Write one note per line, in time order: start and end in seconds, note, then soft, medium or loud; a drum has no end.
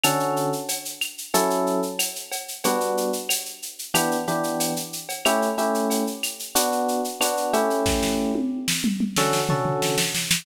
0.04 0.50 D3 loud
0.04 0.50 C#4 loud
0.04 0.50 F#4 medium
0.04 0.50 A4 loud
0.04 cowbell medium
0.04 claves loud
0.04 shaker loud
0.20 shaker medium
0.36 shaker medium
0.53 shaker medium
0.68 cowbell medium
0.68 shaker loud
0.85 shaker medium
1.01 claves medium
1.01 shaker medium
1.18 shaker medium
1.34 1.80 F#3 loud
1.34 1.80 C#4 loud
1.34 1.80 E4 loud
1.34 1.80 A4 loud
1.34 cowbell medium
1.34 shaker loud
1.50 shaker medium
1.67 shaker medium
1.82 shaker medium
1.99 cowbell medium
1.99 claves medium
1.99 shaker loud
2.16 shaker medium
2.32 cowbell medium
2.32 shaker medium
2.48 shaker medium
2.64 3.11 G3 loud
2.64 3.11 B3 loud
2.64 3.11 D4 loud
2.64 3.11 F#4 loud
2.64 cowbell loud
2.64 shaker loud
2.80 shaker medium
2.97 shaker medium
3.13 shaker medium
3.29 cowbell medium
3.29 claves medium
3.29 shaker loud
3.46 shaker medium
3.62 shaker medium
3.79 shaker medium
3.94 4.17 E3 loud
3.94 4.17 B3 loud
3.94 4.17 D4 loud
3.94 4.17 G4 loud
3.94 cowbell medium
3.94 claves medium
3.94 shaker loud
4.11 shaker medium
4.27 4.73 E3 loud
4.27 4.73 B3 medium
4.27 4.73 D4 medium
4.27 4.73 G4 medium
4.27 shaker medium
4.43 shaker medium
4.60 cowbell medium
4.60 shaker loud
4.76 shaker medium
4.93 shaker medium
5.09 cowbell medium
5.09 shaker medium
5.25 5.49 A3 loud
5.25 5.49 C#4 loud
5.25 5.49 E4 loud
5.25 5.49 G4 loud
5.25 cowbell medium
5.25 claves loud
5.25 shaker loud
5.42 shaker medium
5.58 6.04 A3 loud
5.58 6.04 C#4 medium
5.58 6.04 E4 medium
5.58 6.04 G4 medium
5.58 shaker medium
5.74 shaker medium
5.90 cowbell medium
5.90 shaker loud
6.07 shaker medium
6.23 claves medium
6.23 shaker medium
6.39 shaker medium
6.55 7.01 B3 loud
6.55 7.01 D4 loud
6.55 7.01 F#4 loud
6.55 cowbell medium
6.55 shaker loud
6.72 shaker medium
6.88 shaker medium
7.04 shaker medium
7.21 7.51 B3 medium
7.21 7.51 D4 loud
7.21 7.51 F#4 medium
7.21 cowbell medium
7.21 claves medium
7.21 shaker loud
7.37 shaker medium
7.53 8.32 A3 loud
7.53 8.32 C#4 loud
7.53 8.32 E4 loud
7.53 8.32 G4 loud
7.53 cowbell medium
7.53 shaker medium
7.70 shaker medium
7.86 kick medium
7.86 snare medium
8.03 snare medium
8.35 high tom medium
8.68 snare medium
8.84 mid tom medium
9.00 mid tom medium
9.16 9.40 D3 loud
9.16 9.40 C#4 loud
9.16 9.40 F#4 loud
9.16 9.40 A4 loud
9.16 snare medium
9.33 snare medium
9.49 9.95 D3 medium
9.49 9.95 C#4 medium
9.49 9.95 F#4 medium
9.49 9.95 A4 medium
9.49 floor tom loud
9.65 floor tom medium
9.82 snare medium
9.98 snare loud
10.15 snare medium
10.31 snare loud